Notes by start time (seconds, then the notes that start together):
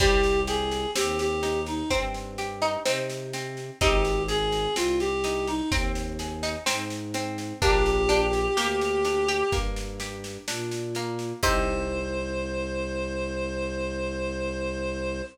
0.00 C2 G3 C4 G4, kick, snare
0.23 snare
0.47 G4 G#4, snare
0.71 snare
0.95 D#2 C4 G4, snare
1.19 G4, snare
1.43 D#4, snare
1.66 D#4, snare
1.90 G2 C4, kick, snare
2.14 snare
2.38 G4, snare
2.62 D#4, snare
2.85 C3 C4 D#4, snare
3.10 snare
3.33 C4, snare
3.57 snare
3.81 G#1 C4 D#4 G4, kick, snare
4.05 snare
4.28 G#4, snare
4.52 snare
4.76 C2 C4 F4, snare
5.00 G4, snare
5.24 D#4, snare
5.47 D#4, snare
5.70 D#2 C4, kick, snare
5.95 snare
6.19 G#4, snare
6.43 D#4, snare
6.66 G#2 C4 D#4, snare
6.90 snare
7.14 C4, snare
7.38 snare
7.62 A#1 A#3 D4 G4, kick, snare
7.86 snare
8.09 D4 G4, snare
8.33 snare
8.57 D2 A#3 G4, snare
8.81 snare
9.05 D4, snare
9.28 G4, snare
9.52 G2 A#3, kick, snare
9.76 snare
10.00 G4, snare
10.24 snare
10.47 A#2 D4, snare
10.71 snare
10.95 A#3, snare
11.19 snare
11.43 C2 C4 D#4 G4 C5, kick, crash